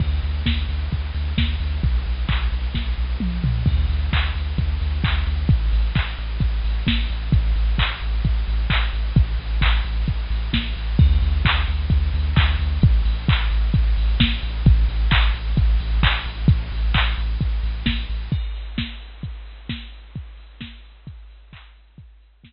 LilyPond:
<<
  \new Staff \with { instrumentName = "Synth Bass 2" } { \clef bass \time 4/4 \key d \major \tempo 4 = 131 d,8 d,8 d,8 d,8 d,8 d,8 d,8 d,8 | b,,8 b,,8 b,,8 b,,8 b,,8 b,,8 b,,8 b,,8 | d,8 d,8 d,8 d,8 d,8 d,8 d,8 d,8 | a,,8 a,,8 a,,8 a,,8 a,,8 a,,8 a,,8 a,,8 |
a,,8 a,,8 a,,8 a,,8 a,,8 a,,8 a,,8 a,,8 | a,,8 a,,8 a,,8 a,,8 a,,8 a,,8 a,,8 a,,8 | d,8 d,8 d,8 d,8 d,8 d,8 d,8 d,8 | a,,8 a,,8 a,,8 a,,8 a,,8 a,,8 a,,8 a,,8 |
a,,8 a,,8 a,,8 a,,8 a,,8 a,,8 a,,8 a,,8 | a,,8 a,,8 a,,8 a,,8 a,,8 a,,8 a,,8 a,,8 | \key g \major r1 | r1 |
r1 | }
  \new DrumStaff \with { instrumentName = "Drums" } \drummode { \time 4/4 <cymc bd>8 hho8 <bd sn>8 hho8 <hh bd>8 hho8 <bd sn>8 hho8 | <hh bd>8 hho8 <hc bd>8 hho8 <bd sn>4 toml8 tomfh8 | <cymc bd>8 hho8 <hc bd>8 hho8 <hh bd>8 hho8 <hc bd>8 hho8 | <hh bd>8 hho8 <hc bd>8 hho8 <hh bd>8 hho8 <bd sn>8 hho8 |
<hh bd>8 hho8 <hc bd>8 hho8 <hh bd>8 hho8 <hc bd>8 hho8 | <hh bd>8 hho8 <hc bd>8 hho8 <hh bd>8 hho8 <bd sn>8 hho8 | <cymc bd>8 hho8 <hc bd>8 hho8 <hh bd>8 hho8 <hc bd>8 hho8 | <hh bd>8 hho8 <hc bd>8 hho8 <hh bd>8 hho8 <bd sn>8 hho8 |
<hh bd>8 hho8 <hc bd>8 hho8 <hh bd>8 hho8 <hc bd>8 hho8 | <hh bd>8 hho8 <hc bd>8 hho8 <hh bd>8 hho8 <bd sn>8 hho8 | <cymc bd>16 hh16 hho16 hh16 <bd sn>16 hh16 hho16 hh16 <hh bd>16 hh16 hho16 hh16 <bd sn>16 hh16 hho16 hh16 | <hh bd>16 hh16 hho16 hh16 <bd sn>16 hh16 hho16 hh16 <hh bd>16 hh16 hho16 hh16 <hc bd>16 hh16 hho16 hh16 |
<hh bd>16 hh16 hho16 hh16 <bd sn>4 r4 r4 | }
>>